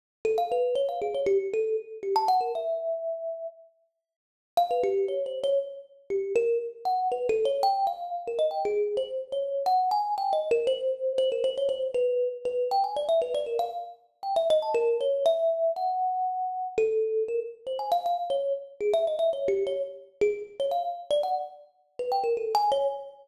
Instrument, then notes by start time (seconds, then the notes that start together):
kalimba
0.25 A4
0.38 F5
0.52 B4
0.75 C#5
0.89 F5
1.02 G#4
1.15 C#5
1.26 G4
1.53 A4
2.03 G4
2.16 A5
2.28 F#5
2.41 A#4
2.55 E5
4.57 F5
4.71 B4
4.83 G4
5.08 C#5
5.26 C5
5.44 C#5
6.10 G4
6.36 A#4
6.85 F#5
7.12 B4
7.29 A4
7.45 C#5
7.63 G5
7.87 F5
8.27 A#4
8.39 D#5
8.51 G5
8.65 G#4
8.97 C5
9.32 C#5
9.66 F#5
9.91 G#5
10.18 G5
10.33 D#5
10.51 A#4
10.67 C5
11.18 C5
11.32 A#4
11.44 C5
11.58 C#5
11.69 C5
11.94 B4
12.45 B4
12.71 G5
12.84 G#5
12.96 D5
13.09 E5
13.22 B4
13.34 D5
13.46 A#4
13.59 F5
14.23 G5
14.36 E5
14.50 D#5
14.62 A5
14.74 A#4
15.01 C#5
15.26 E5
15.76 F#5
16.78 A4
17.28 A#4
17.67 C5
17.79 G#5
17.92 F5
18.06 F5
18.30 C#5
18.81 G#4
18.94 E5
19.07 D#5
19.19 E5
19.33 C#5
19.48 G4
19.67 C#5
20.21 G#4
20.60 C#5
20.71 F5
21.11 D5
21.23 F#5
21.99 B4
22.12 G5
22.24 A#4
22.37 A4
22.55 G#5
22.72 C#5